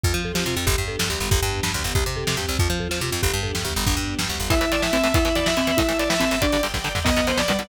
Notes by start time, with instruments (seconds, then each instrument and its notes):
0.04 electric bass (finger) F2, string ensemble 1 C4 F4, marimba F4, kick, floor tom
0.14 electric bass (finger) F3, floor tom
0.25 marimba A4, floor tom
0.34 electric bass (finger) F3, marimba G4, snare
0.46 electric bass (finger) C3, marimba F4, floor tom
0.56 electric bass (finger) F2, marimba F4, floor tom
0.66 electric bass (finger) G1, string ensemble 1 B3 D4 G4, marimba G4, kick, floor tom
0.78 electric bass (finger) G2, floor tom
0.88 marimba A4, floor tom
0.99 electric bass (finger) G2, string ensemble 1 G3 B3 G4, snare
1.10 electric bass (finger) D2, marimba G4, floor tom
1.20 electric bass (finger) G1, floor tom
1.31 electric bass (finger) G1, string ensemble 1 B3 D4 G4, marimba G4, kick, floor tom
1.42 electric bass (finger) G2, floor tom
1.52 floor tom
1.63 electric bass (finger) G2, string ensemble 1 G3 B3 G4, snare
1.74 electric bass (finger) D2, floor tom
1.84 electric bass (finger) G1, floor tom
1.95 electric bass (finger) C2, string ensemble 1 C4 G4, marimba G4, kick, floor tom
2.06 electric bass (finger) C3, floor tom
2.16 marimba A4, floor tom
2.27 electric bass (finger) C3, snare
2.37 electric bass (finger) G2, marimba G4, floor tom
2.49 electric bass (finger) C2
2.59 electric bass (finger) F2, string ensemble 1 C4 F4, marimba F4, kick, floor tom
2.70 electric bass (finger) F3, floor tom
2.80 marimba A4, floor tom
2.89 electric bass (finger) F3, marimba F4, snare
3.01 electric bass (finger) C3, marimba F4, floor tom
3.12 electric bass (finger) F2, marimba F4, floor tom
3.22 electric bass (finger) G1, string ensemble 1 B3 D4 G4, marimba G4, kick, floor tom
3.33 electric bass (finger) G2, floor tom
3.43 marimba A4, floor tom
3.55 electric bass (finger) G2, string ensemble 1 G3 B3 G4, snare
3.65 electric bass (finger) D2, marimba G4, floor tom
3.76 electric bass (finger) G1, floor tom
3.86 electric bass (finger) G1, string ensemble 1 B3 D4 G4, marimba D4, kick, floor tom
3.97 electric bass (finger) G2, floor tom
4.08 floor tom
4.18 electric bass (finger) G2, string ensemble 1 G3 B3 G4, snare
4.29 electric bass (finger) D2, floor tom
4.40 electric bass (finger) G1, floor tom
4.50 electric bass (finger) A1, overdriven guitar A2 E3, marimba E4, string ensemble 1 E5 A5, distortion guitar E5, kick, closed hi-hat
4.61 electric bass (finger) A1, overdriven guitar A2 E3, closed hi-hat
4.72 electric bass (finger) A1, overdriven guitar A2 E3, distortion guitar D5, closed hi-hat
4.82 electric bass (finger) A1, overdriven guitar A2 E3, distortion guitar E5, snare
4.93 electric bass (finger) A1, overdriven guitar A2 E3, marimba C4, closed hi-hat
5.04 electric bass (finger) A1, overdriven guitar A2 E3, closed hi-hat
5.14 electric bass (finger) E2, overdriven guitar B2 E3, marimba E4, string ensemble 1 E5 B5, distortion guitar E5, kick, closed hi-hat
5.25 electric bass (finger) E2, overdriven guitar B2 E3, closed hi-hat
5.35 electric bass (finger) E2, overdriven guitar B2 E3, distortion guitar D5, closed hi-hat
5.46 electric bass (finger) E2, overdriven guitar B2 E3, distortion guitar E5, snare
5.57 electric bass (finger) E2, overdriven guitar B2 E3, marimba C4, closed hi-hat
5.67 electric bass (finger) E2, overdriven guitar B2 E3, closed hi-hat
5.77 electric bass (finger) A1, overdriven guitar A2 E3, marimba E4, string ensemble 1 E5 A5, distortion guitar E5, kick, closed hi-hat
5.89 electric bass (finger) A1, overdriven guitar A2 E3, closed hi-hat
5.98 electric bass (finger) A1, overdriven guitar A2 E3, distortion guitar D5, closed hi-hat
6.09 electric bass (finger) A1, overdriven guitar A2 E3, distortion guitar E5, snare
6.20 electric bass (finger) A1, overdriven guitar A2 E3, marimba C4, closed hi-hat
6.31 electric bass (finger) G1, overdriven guitar A2 E3, closed hi-hat
6.42 overdriven guitar G2 D3, marimba D4, distortion guitar D5, string ensemble 1 D5 G5, kick, closed hi-hat
6.52 electric bass (finger) G1, overdriven guitar G2 D3, closed hi-hat
6.63 electric bass (finger) G1, overdriven guitar G2 D3, closed hi-hat
6.74 electric bass (finger) G1, overdriven guitar G2 D3, kick, snare
6.84 electric bass (finger) G1, overdriven guitar G2 D3
6.95 electric bass (finger) G1, overdriven guitar G2 D3, floor tom
7.04 electric bass (finger) B1, overdriven guitar F#2 B2 D#3, marimba B3, string ensemble 1 B4 D#5 F#5, distortion guitar D#5, kick, crash
7.16 electric bass (finger) B1, overdriven guitar F#2 B2 D#3, closed hi-hat
7.27 electric bass (finger) B1, overdriven guitar F#2 B2 D#3, distortion guitar C5, closed hi-hat
7.37 electric bass (finger) B1, overdriven guitar F#2 B2 D#3, string ensemble 1 B4 F#5 B5, distortion guitar D5, snare
7.48 electric bass (finger) B1, overdriven guitar F#2 B2 D#3, marimba G3, closed hi-hat
7.59 electric bass (finger) B1, overdriven guitar F#2 B2 D#3, closed hi-hat